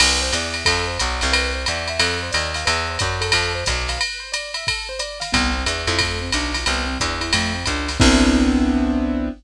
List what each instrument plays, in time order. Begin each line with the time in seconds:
0.00 electric bass (finger) C2, acoustic grand piano B4, crash, ride
0.22 acoustic grand piano C5
0.33 electric bass (finger) E2, acoustic grand piano D5, hi-hat pedal, ride
0.54 acoustic grand piano E5, ride
0.65 electric bass (finger) F2, acoustic grand piano A4, kick, ride
0.87 acoustic grand piano C5
0.99 electric bass (finger) B1, acoustic grand piano D5, hi-hat pedal, ride
1.21 electric bass (finger) C2, acoustic grand piano F5, snare, ride
1.32 acoustic grand piano B4, ride
1.54 acoustic grand piano C5
1.66 electric bass (finger) E2, acoustic grand piano D5, hi-hat pedal, ride
1.88 acoustic grand piano E5, ride
2.00 electric bass (finger) F2, acoustic grand piano A4, ride
2.23 acoustic grand piano C5
2.31 electric bass (finger) D#2, acoustic grand piano D5, hi-hat pedal, ride
2.54 acoustic grand piano F5, snare, ride
2.65 electric bass (finger) E2, acoustic grand piano B4, ride
2.88 acoustic grand piano C5
2.99 electric bass (finger) F#2, acoustic grand piano D5, kick, hi-hat pedal, ride
3.21 acoustic grand piano A4, ride
3.32 electric bass (finger) F2, ride
3.55 acoustic grand piano C5
3.66 electric bass (finger) B1, acoustic grand piano D5, kick, hi-hat pedal, ride
3.88 acoustic grand piano F5, snare, ride
3.99 acoustic grand piano B4, ride
4.20 acoustic grand piano C5
4.32 acoustic grand piano D5, hi-hat pedal, ride
4.54 acoustic grand piano E5, ride
4.67 acoustic grand piano A4, kick, ride
4.89 acoustic grand piano C5
4.99 acoustic grand piano D5, hi-hat pedal, ride
5.20 acoustic grand piano F5, snare, ride
5.32 electric bass (finger) C2, acoustic grand piano B3, kick, ride
5.53 acoustic grand piano C4
5.65 electric bass (finger) E2, acoustic grand piano D4, hi-hat pedal, ride
5.87 electric bass (finger) F2, acoustic grand piano E4, ride
5.99 acoustic grand piano A3, kick, ride
6.22 acoustic grand piano C4
6.32 electric bass (finger) B1, acoustic grand piano D4, hi-hat pedal, ride
6.54 acoustic grand piano F4, snare, ride
6.66 electric bass (finger) C2, acoustic grand piano B3, ride
6.87 acoustic grand piano C4
7.00 electric bass (finger) E2, acoustic grand piano D4, kick, hi-hat pedal, ride
7.21 acoustic grand piano E4, ride
7.33 electric bass (finger) F2, acoustic grand piano A3, ride
7.54 acoustic grand piano C4
7.66 electric bass (finger) C#2, acoustic grand piano D4, kick, hi-hat pedal, ride
7.88 acoustic grand piano F4, snare, ride
8.00 electric bass (finger) C2, acoustic grand piano B3 C4 D4 E4, kick, crash